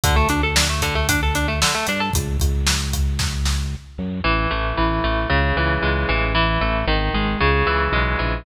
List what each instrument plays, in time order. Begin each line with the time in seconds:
0.04 synth bass 1 D2, overdriven guitar D3, kick, closed hi-hat
0.16 overdriven guitar A3
0.29 synth bass 1 D2, overdriven guitar D4, closed hi-hat
0.43 overdriven guitar A4
0.56 overdriven guitar D4, snare
0.69 overdriven guitar A3
0.82 overdriven guitar D3, kick, closed hi-hat
0.95 overdriven guitar A3
1.09 overdriven guitar D4, kick, closed hi-hat
1.23 overdriven guitar A4
1.35 overdriven guitar D4, closed hi-hat
1.48 overdriven guitar A3
1.62 overdriven guitar D3, snare
1.75 overdriven guitar A3
1.87 synth bass 1 G2, overdriven guitar D4, closed hi-hat
2.00 overdriven guitar A4
2.13 synth bass 1 C#2, kick, closed hi-hat
2.40 synth bass 1 C#2, kick, closed hi-hat
2.67 snare
2.93 kick, closed hi-hat
3.19 kick, snare
3.46 snare
3.98 synth bass 1 F#2
4.24 synth bass 1 A1, overdriven guitar E3
4.51 synth bass 1 A1, overdriven guitar A3
4.77 synth bass 1 A1, overdriven guitar E3
5.04 synth bass 1 A1, overdriven guitar A3
5.30 synth bass 1 C#2, overdriven guitar C#3
5.56 synth bass 1 C#2, overdriven guitar E3
5.82 synth bass 1 C#2, overdriven guitar G#3
6.09 synth bass 1 A1, overdriven guitar E3
6.35 overdriven guitar E3
6.61 synth bass 1 A1, overdriven guitar A3
6.87 synth bass 1 G#1, overdriven guitar D#3
7.14 synth bass 1 G#1, overdriven guitar G#3
7.40 synth bass 1 C#2, overdriven guitar C#3
7.66 synth bass 1 C#2, overdriven guitar E3
7.92 synth bass 1 B1, overdriven guitar G#3
8.19 synth bass 1 A#1, overdriven guitar E3